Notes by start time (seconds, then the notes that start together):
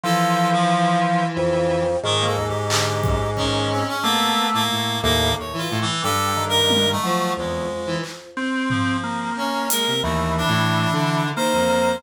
0.03 E3 F3 A4
0.53 F3
1.37 F2
2.03 G#2 D#3
2.20 A#3
2.26 A4
2.36 D#2
2.48 G4
2.69 D3 G4, clap
3.03 F#2, kick
3.36 D#3 C#4, kick
3.72 C4
3.88 C#4
4.03 A3 A#3 B3
4.53 A2 A#3
4.71 A2
5.02 D#2 A2 A#3
5.38 D#2 C#5
5.53 E3
5.58 F4
5.71 A2
5.82 E3
6.03 G2 G3 A4
6.37 D#3
6.49 A#4
6.70 high tom
6.92 A3
7.03 F3 F#3
7.37 E2 F2 G#3
7.87 E3
8.03 clap
8.37 C4
8.70 F3, floor tom
9.03 A#3
9.37 C#4 C#5
9.70 G#3 A#4, closed hi-hat
9.87 C3
10.03 D#2 E3 A3
10.38 D4
10.48 A2
10.92 D3
11.36 D#3 A#3 C5
11.53 F2
11.70 cowbell